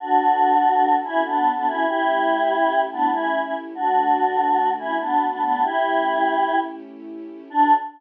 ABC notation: X:1
M:9/8
L:1/16
Q:3/8=96
K:D
V:1 name="Choir Aahs"
[DF]10 [CE]2 [B,D]3 [B,D] [CE]2 | [EG]10 [B,D]2 [CE]3 [CE] z2 | [DF]10 [CE]2 [B,D]3 [B,D] [B,D]2 | [EG]10 z8 |
D6 z12 |]
V:2 name="String Ensemble 1"
[DFA]18 | [A,CEG]18 | [D,A,F]18 | [A,CEG]18 |
[DFA]6 z12 |]